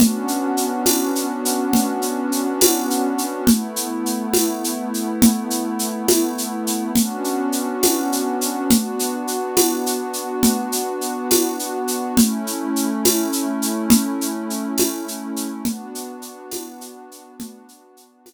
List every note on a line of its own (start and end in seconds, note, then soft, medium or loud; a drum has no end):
0.00 3.44 B3 medium
0.00 3.44 C#4 medium
0.00 3.44 D4 medium
0.00 3.44 F#4 medium
0.00 low conga loud
0.00 shaker medium
0.28 shaker medium
0.57 shaker medium
0.86 tambourine medium
0.86 high conga medium
0.86 shaker medium
1.15 shaker medium
1.45 shaker medium
1.73 low conga loud
1.73 shaker medium
2.02 shaker medium
2.32 shaker medium
2.61 tambourine loud
2.61 high conga loud
2.61 shaker medium
2.90 shaker medium
3.18 shaker medium
3.47 6.92 A3 medium
3.47 6.92 B3 medium
3.47 6.92 E4 medium
3.47 low conga loud
3.47 shaker medium
3.76 shaker medium
4.06 shaker medium
4.34 tambourine medium
4.34 high conga medium
4.34 shaker medium
4.64 shaker medium
4.94 shaker medium
5.22 low conga loud
5.22 shaker medium
5.50 shaker medium
5.79 shaker medium
6.08 tambourine medium
6.08 high conga loud
6.08 shaker medium
6.38 shaker medium
6.67 shaker medium
6.96 8.69 B3 medium
6.96 8.69 C#4 medium
6.96 8.69 D4 medium
6.96 8.69 F#4 medium
6.96 low conga loud
6.96 shaker medium
7.24 shaker medium
7.52 shaker medium
7.83 tambourine medium
7.83 high conga medium
7.83 shaker medium
8.12 shaker medium
8.41 shaker medium
8.70 12.15 B3 medium
8.70 12.15 D4 medium
8.70 12.15 F#4 medium
8.70 low conga loud
8.70 shaker medium
8.99 shaker medium
9.27 shaker medium
9.57 tambourine medium
9.57 high conga loud
9.57 shaker medium
9.86 shaker medium
10.13 shaker medium
10.43 low conga loud
10.43 shaker medium
10.72 shaker medium
11.01 shaker medium
11.31 tambourine medium
11.31 high conga loud
11.31 shaker medium
11.59 shaker medium
11.88 shaker medium
12.17 15.62 A3 medium
12.17 15.62 C#4 medium
12.17 15.62 E4 medium
12.17 low conga loud
12.17 shaker medium
12.47 shaker medium
12.76 shaker medium
13.05 tambourine medium
13.05 high conga medium
13.05 shaker medium
13.33 shaker medium
13.62 shaker medium
13.90 low conga loud
13.90 shaker loud
14.21 shaker medium
14.50 shaker medium
14.78 tambourine medium
14.78 high conga loud
14.78 shaker medium
15.08 shaker medium
15.36 shaker medium
15.64 18.34 B3 medium
15.64 18.34 D4 medium
15.64 18.34 F#4 medium
15.64 low conga loud
15.64 shaker medium
15.95 shaker medium
16.22 shaker medium
16.52 tambourine medium
16.52 high conga medium
16.52 shaker medium
16.81 shaker medium
17.11 shaker medium
17.40 low conga loud
17.40 shaker loud
17.69 shaker medium
17.97 shaker medium
18.26 tambourine medium
18.26 high conga loud
18.26 shaker medium